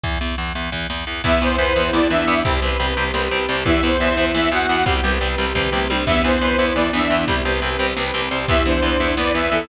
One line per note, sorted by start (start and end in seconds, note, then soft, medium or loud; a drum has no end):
0.04 0.18 E2 medium
0.04 kick loud
0.04 closed hi-hat loud
0.21 0.35 E2 medium
0.21 closed hi-hat medium
0.38 0.53 E2 medium
0.38 closed hi-hat loud
0.55 0.70 E2 medium
0.55 closed hi-hat medium
0.72 0.87 E2 medium
0.72 kick medium
0.90 1.05 E2 medium
0.90 snare loud
1.07 1.22 E2 medium
1.24 1.39 E2 medium
1.24 1.31 E3 medium
1.24 1.56 B3 loud
1.24 1.31 B3 medium
1.24 2.45 B3 medium
1.24 2.45 E4 loud
1.24 1.41 E5 medium
1.24 kick loud
1.24 crash loud
1.41 1.56 E2 medium
1.41 1.48 E3 medium
1.41 1.48 B3 medium
1.41 1.90 C5 medium
1.41 closed hi-hat medium
1.58 1.73 E2 medium
1.58 1.65 E3 medium
1.58 1.65 B3 medium
1.58 1.89 B4 loud
1.58 closed hi-hat loud
1.76 1.91 E2 medium
1.76 1.83 E3 medium
1.76 1.83 B3 medium
1.76 closed hi-hat medium
1.93 2.08 E2 medium
1.93 2.00 E3 medium
1.93 2.00 B3 medium
1.93 2.10 E4 loud
1.93 2.08 D5 medium
1.93 snare loud
2.10 2.25 E2 medium
2.10 2.17 E3 medium
2.10 2.17 B3 medium
2.10 2.43 D4 medium
2.10 2.40 E5 medium
2.10 closed hi-hat loud
2.27 2.42 E2 medium
2.27 2.34 E3 medium
2.27 2.34 B3 medium
2.27 closed hi-hat medium
2.45 2.60 C2 loud
2.45 2.53 G3 medium
2.45 3.64 C4 medium
2.45 2.53 C4 medium
2.45 2.60 G4 medium
2.45 3.64 G4 medium
2.45 kick loud
2.45 closed hi-hat loud
2.62 2.77 C2 medium
2.62 2.69 G3 medium
2.62 2.69 C4 medium
2.62 3.09 B4 medium
2.62 closed hi-hat medium
2.79 2.94 C2 medium
2.79 2.86 G3 medium
2.79 2.86 C4 medium
2.79 closed hi-hat loud
2.97 3.12 C2 medium
2.97 3.04 G3 medium
2.97 3.04 C4 medium
2.97 closed hi-hat medium
3.14 3.28 C2 medium
3.14 3.21 G3 medium
3.14 3.21 C4 medium
3.14 3.45 B4 medium
3.14 snare loud
3.31 3.46 C2 medium
3.31 3.38 G3 medium
3.31 3.38 C4 medium
3.31 closed hi-hat medium
3.48 3.63 C2 medium
3.48 3.56 G3 medium
3.48 3.56 C4 medium
3.48 3.64 C5 medium
3.48 closed hi-hat medium
3.65 3.80 E2 loud
3.65 3.72 E3 medium
3.65 4.85 B3 medium
3.65 3.72 B3 medium
3.65 4.85 E4 medium
3.65 3.93 E4 loud
3.65 3.82 E5 medium
3.65 kick loud
3.65 closed hi-hat loud
3.83 3.97 E2 medium
3.83 3.90 E3 medium
3.83 3.90 B3 medium
3.83 4.25 C5 medium
3.83 closed hi-hat medium
4.00 4.15 E2 medium
4.00 4.08 E3 medium
4.00 4.08 B3 medium
4.00 4.31 E5 loud
4.00 closed hi-hat loud
4.17 4.32 E2 medium
4.17 4.25 E3 medium
4.17 4.25 B3 medium
4.17 closed hi-hat medium
4.34 4.49 E2 loud
4.34 4.42 E3 medium
4.34 4.42 B3 medium
4.34 4.49 E4 loud
4.34 4.51 E5 medium
4.34 snare loud
4.51 4.66 E2 medium
4.51 4.58 E3 medium
4.51 4.58 B3 medium
4.51 4.84 F#4 medium
4.51 4.85 F#5 medium
4.51 closed hi-hat medium
4.69 4.84 E2 medium
4.69 4.76 E3 medium
4.69 4.76 B3 medium
4.69 closed hi-hat medium
4.86 5.01 C2 medium
4.86 4.93 G3 medium
4.86 6.05 C4 medium
4.86 4.93 C4 medium
4.86 6.05 G4 medium
4.86 5.02 G4 medium
4.86 kick loud
4.86 closed hi-hat loud
5.03 5.18 C2 medium
5.03 5.11 G3 medium
5.03 5.11 C4 medium
5.03 5.50 B4 medium
5.03 closed hi-hat medium
5.21 5.35 C2 medium
5.21 5.28 G3 medium
5.21 5.28 C4 medium
5.21 closed hi-hat loud
5.38 5.53 C2 medium
5.38 5.45 G3 medium
5.38 5.45 C4 medium
5.38 closed hi-hat medium
5.55 5.70 C2 medium
5.55 5.62 G3 medium
5.55 5.62 C4 medium
5.55 5.86 B4 medium
5.55 kick medium
5.55 floor tom medium
5.72 5.87 C2 medium
5.72 5.79 G3 medium
5.72 5.79 C4 medium
5.72 mid tom medium
5.90 6.05 C2 medium
5.90 5.97 G3 medium
5.90 5.97 C4 medium
5.90 6.05 C5 medium
5.90 high tom loud
6.06 6.22 E2 loud
6.06 6.14 E3 medium
6.06 7.26 B3 medium
6.06 6.37 B3 loud
6.06 6.14 B3 medium
6.06 7.26 E4 medium
6.06 6.22 E5 medium
6.06 kick loud
6.06 crash loud
6.24 6.39 E2 medium
6.24 6.31 E3 medium
6.24 6.31 B3 medium
6.24 6.67 C5 medium
6.24 closed hi-hat medium
6.41 6.56 E2 medium
6.41 6.48 E3 medium
6.41 6.48 B3 medium
6.41 6.70 B4 loud
6.41 closed hi-hat loud
6.58 6.73 E2 medium
6.58 6.66 E3 medium
6.58 6.66 B3 medium
6.58 closed hi-hat medium
6.75 6.90 E2 medium
6.75 6.83 E3 medium
6.75 6.83 B3 medium
6.75 6.91 E4 loud
6.75 6.91 D5 medium
6.75 snare loud
6.93 7.08 E2 medium
6.93 7.00 E3 medium
6.93 7.00 B3 medium
6.93 7.26 D4 loud
6.93 7.22 E5 medium
6.93 closed hi-hat medium
7.10 7.25 E2 medium
7.10 7.17 E3 medium
7.10 7.17 B3 medium
7.10 closed hi-hat medium
7.28 7.42 C2 medium
7.28 7.35 G3 medium
7.28 7.35 C4 medium
7.28 8.48 C4 medium
7.28 7.43 G4 medium
7.28 8.48 G4 medium
7.28 kick loud
7.28 closed hi-hat loud
7.45 7.60 C2 medium
7.45 7.52 G3 medium
7.45 7.52 C4 medium
7.45 7.92 B4 medium
7.45 closed hi-hat medium
7.62 7.77 C2 medium
7.62 7.69 G3 medium
7.62 7.69 C4 medium
7.62 closed hi-hat loud
7.79 7.94 C2 medium
7.79 7.86 G3 medium
7.79 7.86 C4 medium
7.79 closed hi-hat medium
7.97 8.11 C2 medium
7.97 8.03 G3 medium
7.97 8.03 C4 medium
7.97 8.28 B4 medium
7.97 snare loud
8.14 8.29 C2 medium
8.14 8.21 G3 medium
8.14 8.21 C4 medium
8.14 closed hi-hat medium
8.31 8.46 C2 medium
8.31 8.38 G3 medium
8.31 8.38 C4 medium
8.31 8.47 C5 medium
8.31 closed hi-hat loud
8.48 8.63 E2 medium
8.48 8.56 E3 medium
8.48 8.56 B3 medium
8.48 9.68 B3 medium
8.48 8.64 E4 medium
8.48 9.68 E4 medium
8.48 8.63 E5 medium
8.48 kick loud
8.48 closed hi-hat loud
8.66 8.80 E2 medium
8.66 8.73 E3 medium
8.66 8.73 B3 medium
8.66 9.14 D4 loud
8.66 9.07 C5 medium
8.66 closed hi-hat medium
8.82 8.97 E2 medium
8.82 8.90 E3 medium
8.82 8.90 B3 medium
8.82 closed hi-hat loud
9.00 9.15 E2 medium
9.00 9.07 E3 medium
9.00 9.07 B3 medium
9.00 closed hi-hat medium
9.17 9.32 E2 medium
9.17 9.25 E3 medium
9.17 9.25 B3 medium
9.17 9.49 B4 loud
9.17 9.32 D5 medium
9.17 snare loud
9.34 9.49 E2 medium
9.34 9.41 E3 medium
9.34 9.41 B3 medium
9.34 9.66 E5 medium
9.34 closed hi-hat medium
9.52 9.66 E2 medium
9.52 9.58 E3 medium
9.52 9.58 B3 medium
9.52 9.66 A4 loud
9.52 closed hi-hat medium